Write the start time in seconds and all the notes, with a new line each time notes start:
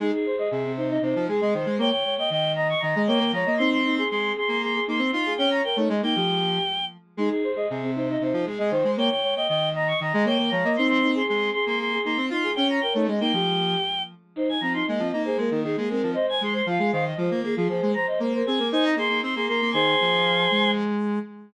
0.00 G#3 D#4 G#4
0.13 G#4
0.26 C5
0.36 G#4 D#5
0.51 C3 G#4
0.64 C4
0.77 D#4 C5
0.90 D#4 D#5
1.02 C3 D#4 C5
1.15 F3
1.28 G#3 G#4
1.41 G#3 D#5
1.54 D#3 C5
1.66 G#3
1.78 A#3 C#5 G5
1.90 G5
2.04 C#5
2.18 D#5 G5
2.30 D#3 D#5 G5
2.55 D#5 A#5
2.69 C#6
2.80 D#3 D#5 A#5
2.96 G#3 D#5
3.07 A#3 C#5 G5
3.19 A#3
3.32 F3 C#5 A#5
3.46 A#3 D#5
3.57 C4 D#4 C6
3.71 C6
3.85 D#4
3.96 G#4 C6
4.09 G#3 G#4 C6
4.36 G#4 C6
4.48 A#3 C6
4.62 G#4 C6
4.74 G#4
4.87 A#3 D#4 C6
4.99 C4
5.12 D#4 F4 C6
5.26 G#4
5.37 C#4 C#5 G5
5.51 A#5
5.64 A#4 G5
5.76 A3 D#4 C#5
5.89 G#3 D#5
6.02 A#3 D#4 G5
6.16 F3 G4
7.17 G#3 D#4 G#4
7.29 G#4
7.44 C5
7.54 G#4 D#5
7.69 C3 G#4
7.82 C4
7.95 D#4 C5
8.08 D#4 D#5
8.20 C3 D#4 C5
8.33 F3
8.45 G#3 G#4
8.58 G#3 D#5
8.70 D#3 C5
8.84 G#3
8.97 A#3 C#5 G5
9.10 G5
9.23 C#5
9.35 D#5 G5
9.48 D#3 D#5 G5
9.74 D#5 A#5
9.88 C#6
10.00 D#3 D#5 A#5
10.13 G#3 D#5
10.25 A#3 C#5 G5
10.38 A#3
10.50 F3 C#5 A#5
10.64 A#3 D#5
10.76 C4 D#4 C6
10.87 C6
11.02 D#4
11.15 G#4 C6
11.27 G#3 G#4 C6
11.53 G#4 C6
11.67 A#3 C6
11.79 G#4 C6
11.92 G#4
12.04 A#3 D#4 C6
12.17 C4
12.30 D#4 F4 C6
12.43 G#4
12.55 C#4 C#5 G5
12.70 A#5
12.81 A#4 G5
12.93 A3 D#4 C#5
13.07 G#3 D#5
13.20 A#3 D#4 G5
13.33 F3 G4
14.36 D#4 C5
14.49 G#5
14.61 F3 C4 A#5
14.74 D#4 C6
14.87 G#3 A#3 D#5
14.99 F3 C4
15.10 A#3 D#4 D#5
15.25 G#4 C5
15.37 G#3 A#3 A#4
15.51 D#3
15.64 D#3 G#4
15.77 G#3 A#3 G#4
15.90 G#3 C4 A#4
16.03 F3
16.14 C5 D#5
16.29 G#5
16.41 G#3 G#4 C6
16.53 C5 C6
16.66 F3 F4 F5
16.79 G#3 G#4
16.92 D#3 C5 F5
17.05 D#5
17.17 F3 F4 C5
17.31 A#3
17.43 A#3 G#4
17.55 F3 F4 G#4
17.68 F3 G#4 C5
17.82 G#3
17.94 C5 A#5
18.07 D#5
18.20 A#3 A#4 C5
18.34 A#4 C5
18.46 C4 G#4 G#5
18.58 A#3 A#4
18.72 D#4 C5 G#5
18.84 D#5 A#5
18.96 A#3 G#4 C6
19.09 A#3
19.23 C4 C6
19.35 A#3 G#4 C6
19.46 A#3 A#4 C6
19.61 A#3
19.72 D#3 G#4 C5 G#5 C6
20.01 F3
20.51 G#3